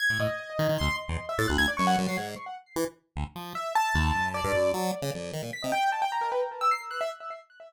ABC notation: X:1
M:6/8
L:1/16
Q:3/8=101
K:none
V:1 name="Acoustic Grand Piano"
_a'2 _e6 c'2 z2 | z e a' _g' _a' d _d' _g z c'' z2 | z12 | e2 a6 d4 |
z8 b' _e g2 | a g _b _B =B z2 e' c'' z _g' e |]
V:2 name="Lead 1 (square)" clef=bass
z A,, A,, z3 _E, E, D,, z2 =E,, | z2 A,, D,, D,, z _G,,2 G,, _G, _A,,2 | z4 E, z3 D,, z F,2 | z4 _E,,2 _G,,3 =G,, _G,,2 |
_G,2 z _D, F,,2 _E, _B,, z C, z2 | z12 |]